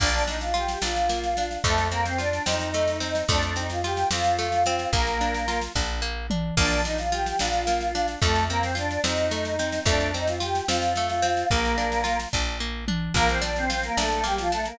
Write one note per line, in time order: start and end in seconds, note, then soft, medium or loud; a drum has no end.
0.00 0.76 A#1 loud
0.00 0.24 A#3 loud
0.00 0.23 D4 medium
0.00 0.23 D5 loud
0.00 kick loud
0.00 snare medium
0.00 crash loud
0.14 snare medium
0.27 0.52 D4 medium
0.27 0.40 D#4 medium
0.27 0.40 D#5 medium
0.27 snare medium
0.41 0.54 F4 medium
0.41 0.54 F5 medium
0.41 snare medium
0.54 0.79 F4 medium
0.54 0.81 G4 medium
0.54 0.81 G5 medium
0.54 snare medium
0.68 snare medium
0.82 1.58 A#1 medium
0.82 1.07 D4 medium
0.82 1.53 F4 loud
0.82 1.53 F5 loud
0.82 snare loud
0.96 snare medium
1.09 1.34 A#3 medium
1.09 snare medium
1.24 snare medium
1.37 1.63 D4 medium
1.37 snare medium
1.51 snare medium
1.64 2.40 F2 loud
1.64 1.87 A3 medium
1.64 1.89 A3 medium
1.64 1.87 A4 loud
1.64 kick loud
1.64 snare medium
1.78 snare medium
1.92 2.05 A#3 loud
1.92 2.16 C4 medium
1.92 2.05 A#4 loud
1.92 snare medium
2.05 2.18 C4 medium
2.05 2.18 C5 medium
2.05 snare medium
2.18 2.43 D4 medium
2.18 2.43 F4 medium
2.18 2.43 D5 medium
2.18 snare medium
2.33 snare medium
2.46 3.23 F2 medium
2.46 2.71 C4 medium
2.46 3.22 D#4 medium
2.46 3.22 D#5 medium
2.46 snare loud
2.60 snare medium
2.74 2.99 A3 medium
2.74 snare medium
2.88 snare medium
3.00 3.25 C4 medium
3.00 snare medium
3.15 snare medium
3.28 4.04 F2 loud
3.28 3.54 A3 loud
3.28 3.54 D4 medium
3.28 3.54 D5 loud
3.28 kick loud
3.28 snare loud
3.42 snare medium
3.56 3.81 C4 medium
3.56 3.69 D#4 medium
3.56 3.69 D#5 loud
3.56 snare medium
3.70 3.83 F4 medium
3.70 3.83 F5 medium
3.70 snare medium
3.84 4.09 F4 medium
3.84 4.09 G4 medium
3.84 4.09 G5 loud
3.84 snare medium
3.97 snare medium
4.11 4.86 F2 medium
4.11 4.37 C4 medium
4.11 4.92 F4 medium
4.11 4.92 F5 loud
4.11 snare loud
4.24 snare medium
4.39 4.63 A3 medium
4.39 snare medium
4.52 snare medium
4.66 4.91 C4 loud
4.66 snare medium
4.79 snare medium
4.93 5.68 A#1 loud
4.93 5.60 A#3 medium
4.93 5.18 A#3 loud
4.93 5.60 A#4 loud
4.93 kick loud
4.93 snare medium
5.07 snare medium
5.21 5.46 D4 medium
5.21 snare medium
5.34 snare medium
5.48 5.72 F4 medium
5.48 snare loud
5.62 snare medium
5.75 6.51 A#1 loud
5.75 6.00 D4 medium
5.75 kick loud
5.75 snare medium
6.02 6.27 A#3 medium
6.30 6.55 D4 medium
6.30 mid tom loud
6.57 7.33 A#1 loud
6.57 6.82 A#3 loud
6.57 6.81 D4 medium
6.57 6.81 D5 loud
6.57 kick loud
6.57 snare medium
6.57 crash loud
6.71 snare medium
6.85 7.10 D4 medium
6.85 6.98 D#4 medium
6.85 6.98 D#5 medium
6.85 snare medium
6.98 7.11 F4 medium
6.98 7.11 F5 medium
6.98 snare medium
7.12 7.37 F4 medium
7.12 7.38 G4 medium
7.12 7.38 G5 medium
7.12 snare medium
7.26 snare medium
7.39 8.16 A#1 medium
7.39 7.65 D4 medium
7.39 8.11 F4 loud
7.39 8.11 F5 loud
7.39 snare loud
7.53 snare medium
7.67 7.92 A#3 medium
7.67 snare medium
7.81 snare medium
7.95 8.20 D4 medium
7.95 snare medium
8.08 snare medium
8.22 8.98 F2 loud
8.22 8.46 A3 medium
8.22 8.44 A3 medium
8.22 8.44 A4 loud
8.22 kick loud
8.22 snare medium
8.36 snare medium
8.49 8.62 A#3 loud
8.49 8.75 C4 medium
8.49 8.62 A#4 loud
8.49 snare medium
8.63 8.76 C4 medium
8.63 8.76 C5 medium
8.63 snare medium
8.75 9.01 D4 medium
8.75 9.00 F4 medium
8.75 9.01 D5 medium
8.75 snare medium
8.91 snare medium
9.04 9.80 F2 medium
9.04 9.29 C4 medium
9.04 9.79 D#4 medium
9.04 9.79 D#5 medium
9.04 snare loud
9.17 snare medium
9.31 9.56 A3 medium
9.31 snare medium
9.45 snare medium
9.59 9.84 C4 medium
9.59 snare medium
9.72 snare medium
9.86 10.61 F2 loud
9.86 10.11 A3 loud
9.86 10.12 D4 medium
9.86 10.12 D5 loud
9.86 kick loud
9.86 snare loud
10.00 snare medium
10.14 10.39 C4 medium
10.14 10.27 D#4 medium
10.14 10.27 D#5 loud
10.14 snare medium
10.28 10.41 F4 medium
10.28 10.41 F5 medium
10.28 snare medium
10.40 10.65 F4 medium
10.40 10.66 G4 medium
10.40 10.66 G5 loud
10.40 snare medium
10.55 snare medium
10.68 11.44 F2 medium
10.68 10.93 C4 medium
10.68 11.49 F4 medium
10.68 11.49 F5 loud
10.68 snare loud
10.82 snare medium
10.95 11.22 A3 medium
10.95 snare medium
11.09 snare medium
11.22 11.47 C4 loud
11.22 snare medium
11.37 snare medium
11.51 12.26 A#1 loud
11.51 12.17 A#3 medium
11.51 11.76 A#3 loud
11.51 12.17 A#4 loud
11.51 kick loud
11.51 snare medium
11.65 snare medium
11.78 12.02 D4 medium
11.78 snare medium
11.92 snare medium
12.04 12.28 F4 medium
12.04 snare loud
12.20 snare medium
12.33 13.09 A#1 loud
12.33 12.58 D4 medium
12.33 kick loud
12.33 snare medium
12.60 12.85 A#3 medium
12.88 13.13 D4 medium
12.88 mid tom loud
13.14 13.90 A#1 loud
13.14 13.28 A#3 loud
13.14 13.41 A#3 loud
13.14 13.28 A#4 loud
13.14 kick loud
13.14 snare loud
13.29 13.42 C4 medium
13.29 13.42 C5 medium
13.29 snare medium
13.42 13.66 D4 medium
13.42 13.55 D4 medium
13.42 13.55 D5 medium
13.42 snare medium
13.56 13.69 C4 medium
13.56 13.69 C5 loud
13.56 snare medium
13.70 13.83 C4 medium
13.70 13.94 F4 medium
13.70 13.83 C5 loud
13.70 snare loud
13.83 13.97 A#3 medium
13.83 13.97 A#4 loud
13.83 snare medium
13.97 14.73 A#1 medium
13.97 14.10 A3 medium
13.97 14.22 D4 medium
13.97 14.10 A4 loud
13.97 snare loud
14.11 14.24 A3 medium
14.11 14.24 A4 loud
14.11 snare medium
14.24 14.37 G3 medium
14.24 14.48 A#3 medium
14.24 14.37 G4 loud
14.24 snare medium
14.38 14.51 F3 medium
14.38 14.51 F4 loud
14.38 snare medium
14.52 14.65 A3 medium
14.52 14.77 D4 medium
14.52 14.65 A4 loud
14.52 snare medium
14.65 14.78 A#3 loud
14.65 14.78 A#4 loud
14.65 snare medium